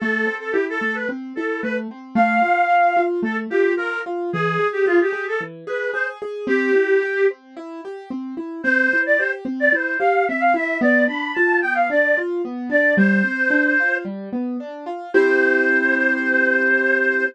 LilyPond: <<
  \new Staff \with { instrumentName = "Clarinet" } { \time 4/4 \key a \minor \tempo 4 = 111 a'8. a'16 g'16 a'8 b'16 r8 a'8 b'16 r8. | f''2 a'16 r16 g'8 bes'8 r8 | gis'8. g'16 f'16 g'8 a'16 r8 b'8 c''16 r8. | g'4. r2 r8 |
\key c \major c''8. d''16 c''16 r8 d''16 c''8 f''8 e''16 f''16 e''8 | d''8 b''8 a''8 g''16 f''16 d''8 r4 d''8 | c''2 r2 | c''1 | }
  \new Staff \with { instrumentName = "Acoustic Grand Piano" } { \time 4/4 \key a \minor a8 c'8 e'8 a8 c'8 e'8 a8 c'8 | a8 f'8 f'8 f'8 a8 f'8 f'8 f'8 | e8 gis'8 gis'8 gis'8 e8 gis'8 gis'8 gis'8 | c'8 e'8 g'8 c'8 e'8 g'8 c'8 e'8 |
\key c \major c'8 e'8 g'8 c'8 e'8 g'8 c'8 e'8 | b8 d'8 f'8 b8 d'8 f'8 b8 d'8 | g8 c'8 d'8 f'8 g8 b8 d'8 f'8 | <c' e' g'>1 | }
>>